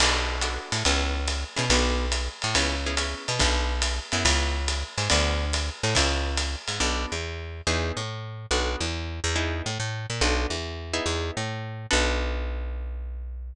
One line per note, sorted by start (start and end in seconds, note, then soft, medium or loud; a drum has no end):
0.00 0.58 B1 medium
0.00 0.37 B3 medium
0.00 0.37 D4 medium
0.00 0.37 F#4 medium
0.00 0.37 A4 medium
0.00 crash loud
0.00 ride loud
0.41 0.77 B3 medium
0.41 0.77 D4 medium
0.41 0.77 F#4 medium
0.41 0.77 A4 medium
0.41 hi-hat pedal medium
0.41 ride medium
0.72 0.83 A2 medium
0.72 ride medium
0.85 1.44 C#2 loud
0.85 1.21 B3 medium
0.85 1.21 C#4 medium
0.85 1.21 E4 medium
0.85 1.21 G#4 medium
0.85 ride medium
1.27 hi-hat pedal medium
1.27 ride medium
1.56 1.69 B2 medium
1.56 1.65 B3 medium
1.56 1.65 C#4 medium
1.56 1.65 E4 medium
1.56 1.65 G#4 medium
1.56 ride medium
1.70 2.29 B1 loud
1.70 2.06 B3 medium
1.70 2.06 D4 medium
1.70 2.06 F#4 medium
1.70 2.06 A4 medium
1.70 ride loud
2.12 hi-hat pedal medium
2.12 ride medium
2.42 2.55 A2 medium
2.42 ride medium
2.55 3.14 C#2 medium
2.55 2.76 B3 medium
2.55 2.76 C#4 medium
2.55 2.76 E4 medium
2.55 2.76 G#4 medium
2.55 ride loud
2.86 2.95 B3 medium
2.86 2.95 C#4 medium
2.86 2.95 E4 medium
2.86 2.95 G#4 medium
2.97 3.32 B3 medium
2.97 3.32 C#4 medium
2.97 3.32 E4 medium
2.97 3.32 G#4 medium
2.97 hi-hat pedal medium
2.97 ride medium
3.28 3.39 B2 medium
3.28 ride medium
3.39 4.00 B1 loud
3.39 3.74 B3 medium
3.39 3.74 D4 medium
3.39 3.74 F#4 medium
3.39 3.74 A4 medium
3.39 kick medium
3.39 ride medium
3.82 hi-hat pedal medium
3.82 ride medium
4.12 4.24 F#2 medium
4.12 4.60 B3 medium
4.12 4.60 C#4 medium
4.12 4.60 E4 medium
4.12 4.60 G#4 medium
4.12 ride medium
4.25 4.84 C#2 loud
4.25 kick medium
4.25 ride loud
4.68 hi-hat pedal medium
4.68 ride medium
4.98 5.09 G#2 medium
4.98 ride medium
5.10 5.70 D2 loud
5.10 5.45 B3 medium
5.10 5.45 D4 medium
5.10 5.45 F#4 medium
5.10 5.45 A4 medium
5.10 ride loud
5.53 hi-hat pedal medium
5.53 ride medium
5.83 5.94 A2 medium
5.83 ride medium
5.95 6.56 C#2 loud
5.95 6.30 B3 medium
5.95 6.30 C#4 medium
5.95 6.30 E4 medium
5.95 6.30 G#4 medium
5.95 kick medium
5.95 ride loud
6.37 hi-hat pedal medium
6.37 ride medium
6.68 6.79 G#2 medium
6.68 ride medium
6.80 7.06 B1 medium
6.80 7.15 B3 medium
6.80 7.15 D4 medium
6.80 7.15 F#4 medium
6.80 7.15 A4 medium
7.12 7.62 E2 medium
7.67 7.92 E2 medium
7.67 8.02 B3 medium
7.67 8.02 D#4 medium
7.67 8.02 E4 medium
7.67 8.02 G#4 medium
7.97 8.46 A2 medium
8.51 8.76 B1 medium
8.51 8.86 B3 medium
8.51 8.86 D4 medium
8.51 8.86 F#4 medium
8.51 8.86 A4 medium
8.80 9.20 E2 medium
9.24 9.62 E2 medium
9.36 9.70 B3 medium
9.36 9.70 D#4 medium
9.36 9.70 E4 medium
9.36 9.70 G#4 medium
9.66 9.78 A2 medium
9.80 10.06 A2 medium
10.10 10.21 A#2 medium
10.21 10.46 B1 medium
10.21 10.56 B3 medium
10.21 10.56 D4 medium
10.21 10.56 F#4 medium
10.21 10.56 A4 medium
10.50 11.00 E2 medium
10.93 11.41 B3 medium
10.93 11.41 D#4 medium
10.93 11.41 E4 medium
10.93 11.41 G#4 medium
11.06 11.31 E2 medium
11.37 11.86 A2 medium
11.91 13.53 B1 loud
11.91 13.51 B3 medium
11.91 13.51 D4 medium
11.91 13.51 F#4 loud
11.91 13.51 A4 loud